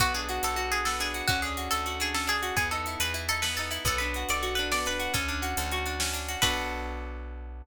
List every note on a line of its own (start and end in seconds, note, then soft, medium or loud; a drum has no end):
0.00 0.39 B1 loud
0.00 0.86 B3 loud
0.00 0.13 F#4 medium
0.00 kick loud
0.00 closed hi-hat loud
0.14 0.72 D4 medium
0.14 0.42 G#4 medium
0.14 closed hi-hat medium
0.29 0.56 F#4 medium
0.29 closed hi-hat medium
0.43 1.22 B1 medium
0.43 1.25 A4 medium
0.43 0.71 A4 medium
0.43 closed hi-hat loud
0.56 1.14 F#4 loud
0.56 closed hi-hat medium
0.72 1.00 D4 medium
0.72 0.85 G#4 medium
0.72 closed hi-hat medium
0.85 1.27 B3 medium
0.85 0.99 A4 medium
0.85 snare loud
1.00 1.27 D4 medium
1.00 1.25 G#4 medium
1.00 closed hi-hat medium
1.14 1.28 F#4 medium
1.14 closed hi-hat medium
1.28 1.69 D2 loud
1.28 2.14 C#4 loud
1.28 1.40 F#4 medium
1.28 kick loud
1.28 closed hi-hat medium
1.42 1.99 D4 medium
1.42 1.69 G#4 medium
1.42 closed hi-hat medium
1.57 1.86 F#4 medium
1.57 closed hi-hat medium
1.71 2.52 D2 medium
1.71 1.95 A4 medium
1.71 2.53 A4 medium
1.71 closed hi-hat loud
1.86 2.42 F#4 medium
1.86 closed hi-hat medium
2.00 2.27 D4 medium
2.00 2.14 G#4 medium
2.00 closed hi-hat medium
2.14 2.55 C#4 medium
2.14 2.28 A4 medium
2.14 snare medium
2.27 2.55 D4 medium
2.27 2.55 G#4 medium
2.27 closed hi-hat medium
2.42 2.56 F#4 medium
2.42 closed hi-hat medium
2.56 2.96 E2 medium
2.56 3.44 B3 loud
2.56 2.68 G#4 medium
2.56 kick loud
2.56 closed hi-hat loud
2.71 3.30 D#4 medium
2.71 2.98 A4 medium
2.71 closed hi-hat medium
2.86 3.14 E4 medium
2.86 closed hi-hat medium
3.00 3.79 E2 medium
3.00 3.83 G#4 medium
3.00 3.25 B4 medium
3.00 closed hi-hat loud
3.14 3.70 E4 medium
3.14 closed hi-hat medium
3.29 3.58 D#4 medium
3.29 3.42 A4 medium
3.29 closed hi-hat medium
3.42 3.84 B3 medium
3.42 3.54 B4 medium
3.42 snare loud
3.57 3.86 D#4 medium
3.57 3.84 A4 medium
3.57 closed hi-hat medium
3.71 3.84 E4 medium
3.71 closed hi-hat medium
3.85 4.24 B1 loud
3.85 4.73 B3 loud
3.85 4.01 A4 medium
3.85 kick loud
3.85 closed hi-hat loud
3.98 4.58 D4 medium
3.98 4.26 B4 medium
3.98 closed hi-hat medium
4.14 4.42 F#4 medium
4.14 closed hi-hat medium
4.29 5.08 B1 medium
4.29 5.11 A4 medium
4.29 4.54 D5 medium
4.29 closed hi-hat medium
4.43 4.99 F#4 medium
4.43 closed hi-hat medium
4.55 4.85 D4 medium
4.55 4.68 B4 medium
4.55 closed hi-hat medium
4.72 5.14 B3 medium
4.72 4.86 D5 medium
4.72 snare loud
4.86 5.13 D4 medium
4.86 5.13 B4 medium
4.86 closed hi-hat medium
4.99 5.13 F#4 medium
4.99 closed hi-hat medium
5.14 5.54 D2 loud
5.14 5.99 C#4 loud
5.14 6.04 A4 medium
5.14 kick loud
5.14 closed hi-hat loud
5.28 5.86 D4 medium
5.28 closed hi-hat medium
5.42 5.72 F#4 medium
5.42 closed hi-hat medium
5.57 6.36 D2 loud
5.57 6.39 A4 medium
5.57 closed hi-hat loud
5.71 6.28 F#4 loud
5.71 closed hi-hat medium
5.86 6.13 D4 medium
5.86 closed hi-hat medium
6.00 6.40 C#4 medium
6.00 snare loud
6.13 6.40 D4 medium
6.13 closed hi-hat medium
6.28 6.42 F#4 medium
6.28 closed hi-hat medium
6.42 7.62 B1 loud
6.42 7.62 B3 loud
6.42 7.62 D4 loud
6.42 7.62 F#4 loud
6.42 7.62 A4 loud
6.42 7.61 B4 loud
6.42 kick loud
6.42 crash loud